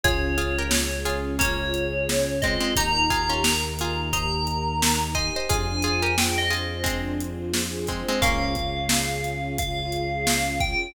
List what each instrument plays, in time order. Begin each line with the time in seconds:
0.03 synth bass 1 C#2, string ensemble 1 C#4 F4 G#4, pad 2 (warm) C#4, pizzicato strings F4 G#4, tubular bells C#5, kick, closed hi-hat
0.38 pizzicato strings F4 G#4, pad 2 (warm) F4, closed hi-hat
0.59 pizzicato strings G4 A#4
0.71 pad 2 (warm) G#4, snare
1.05 pad 2 (warm) C#4, pizzicato strings F4 G#4, closed hi-hat
1.39 pizzicato strings A#3 C#4, pad 2 (warm) F4, tubular bells C#5, kick, closed hi-hat
1.74 pad 2 (warm) G#4, closed hi-hat
2.09 pad 2 (warm) C#4, snare
2.42 pizzicato strings G#3 C4, pad 2 (warm) F4, tubular bells D#5, kick, closed hi-hat
2.60 pizzicato strings G#3 C4
2.76 synth bass 1 D#2, string ensemble 1 D#4 G4 A#4, pad 2 (warm) D#4, pizzicato strings D#4 G4, tubular bells A#5, kick, closed hi-hat
3.10 pizzicato strings F4 G#4, pad 2 (warm) G4, kick, closed hi-hat
3.29 pizzicato strings C#4 F4
3.44 pad 2 (warm) A#4, snare
3.79 pad 2 (warm) D#4, pizzicato strings F4 G#4, closed hi-hat
4.13 pad 2 (warm) G4, pizzicato strings C5 D#5, tubular bells A#5, kick, closed hi-hat
4.47 pad 2 (warm) A#4, closed hi-hat
4.81 pad 2 (warm) D#4, snare
5.15 pad 2 (warm) G4, pizzicato strings C5 D#5, tubular bells G#5, kick, closed hi-hat
5.36 pizzicato strings C5 D#5
5.49 synth bass 1 F2, string ensemble 1 D4 F4 G#4 C5, pad 2 (warm) D4, pizzicato strings F4 G#4, tubular bells G#5, kick, closed hi-hat
5.82 pad 2 (warm) F4, pizzicato strings F4 G#4, closed hi-hat
6.02 pizzicato strings G4 A#4
6.18 pad 2 (warm) G#4, tubular bells G5, snare
6.38 tubular bells D#5
6.50 pizzicato strings F4 G#4, pad 2 (warm) C5, closed hi-hat
6.84 pizzicato strings G#3 C4, pad 2 (warm) D4, kick, closed hi-hat
7.20 pad 2 (warm) F4, closed hi-hat
7.54 pad 2 (warm) G#4, snare
7.87 pizzicato strings G#3 C4, pad 2 (warm) C5, kick, closed hi-hat
8.08 pizzicato strings G#3 C4
8.22 synth bass 1 C#2, pizzicato strings A#3 C#4, pad 2 (warm) C#4, string ensemble 1 C#4 F4 G#4, tubular bells F5, kick, closed hi-hat
8.55 pad 2 (warm) F4, kick, closed hi-hat
8.89 pad 2 (warm) G#4, snare
9.24 pad 2 (warm) C#4, closed hi-hat
9.58 pad 2 (warm) F4, tubular bells F5, kick, closed hi-hat
9.92 pad 2 (warm) G#4, closed hi-hat
10.27 pad 2 (warm) C#4, snare
10.60 pad 2 (warm) F4, tubular bells G5, kick, closed hi-hat